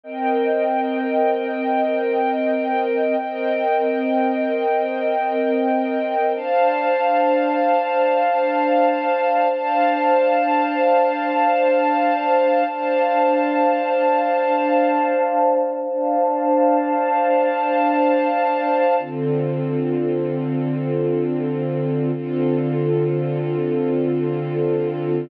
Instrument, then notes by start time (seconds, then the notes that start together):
string ensemble 1
0.03 C4 A#4 D#5 G5
3.20 C4 A#4 D#5 G5
6.35 D4 C5 F5 A5
9.51 D4 C5 F5 A5
12.67 D4 C5 F5 A5
15.83 D4 C5 F5 A5
18.99 D3 C4 F4 A4
22.15 D3 C4 F4 A4